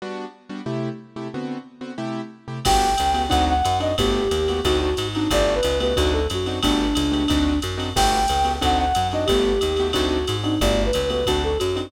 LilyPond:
<<
  \new Staff \with { instrumentName = "Flute" } { \time 4/4 \key g \major \tempo 4 = 181 r1 | r1 | g''2 fis''8 fis''4 ees''8 | g'2 fis'8 fis'4 ees'8 |
d''8. b'8. b'8 fis'8 a'8 fis'4 | d'2. r4 | g''2 fis''8 fis''4 ees''8 | g'2 fis'8 fis'4 ees'8 |
d''8. b'8. b'8 fis'8 a'8 fis'4 | }
  \new Staff \with { instrumentName = "Acoustic Grand Piano" } { \time 4/4 \key g \major <g b d' fis'>4. <g b d' fis'>8 <c a e' g'>4. <c a e' g'>8 | <d b c' fis'>4. <d b c' fis'>8 <c a e' g'>4. <c a e' g'>8 | <a b fis' g'>4. <a b fis' g'>8 <c' d' ees' fis'>4. <c' d' ees' fis'>8 | <a b fis' g'>4. <a b fis' g'>8 <c' d' ees' fis'>4. <c' d' ees' fis'>8 |
<a b fis' g'>4. <a b fis' g'>8 <c' d' ees' fis'>4. <c' d' ees' fis'>8 | <a b fis' g'>4. <a b fis' g'>8 <c' d' ees' fis'>4. <c' d' ees' fis'>8 | <a b fis' g'>4. <a b fis' g'>8 <c' d' ees' fis'>4. <c' d' ees' fis'>8 | <a b fis' g'>4. <a b fis' g'>8 <c' d' ees' fis'>4. <c' d' ees' fis'>8 |
<a b fis' g'>4. <a b fis' g'>8 <c' d' ees' fis'>4. <c' d' ees' fis'>8 | }
  \new Staff \with { instrumentName = "Electric Bass (finger)" } { \clef bass \time 4/4 \key g \major r1 | r1 | g,,4 cis,4 d,4 fis,4 | g,,4 ees,4 d,4 gis,4 |
g,,4 cis,4 d,4 fis,4 | g,,4 cis,4 d,4 fis,4 | g,,4 cis,4 d,4 fis,4 | g,,4 ees,4 d,4 gis,4 |
g,,4 cis,4 d,4 fis,4 | }
  \new DrumStaff \with { instrumentName = "Drums" } \drummode { \time 4/4 r4 r4 r4 r4 | r4 r4 r4 r4 | <cymc bd cymr>4 <hhp cymr>8 cymr8 <bd cymr>4 <hhp cymr>8 cymr8 | <bd cymr>4 <hhp cymr>8 cymr8 <bd cymr>4 <hhp cymr>8 cymr8 |
<bd cymr>4 <hhp cymr>8 cymr8 <bd cymr>4 <hhp cymr>8 cymr8 | <bd cymr>4 <hhp cymr>8 cymr8 <bd cymr>4 <hhp cymr>8 cymr8 | <cymc bd cymr>4 <hhp cymr>8 cymr8 <bd cymr>4 <hhp cymr>8 cymr8 | <bd cymr>4 <hhp cymr>8 cymr8 <bd cymr>4 <hhp cymr>8 cymr8 |
<bd cymr>4 <hhp cymr>8 cymr8 <bd cymr>4 <hhp cymr>8 cymr8 | }
>>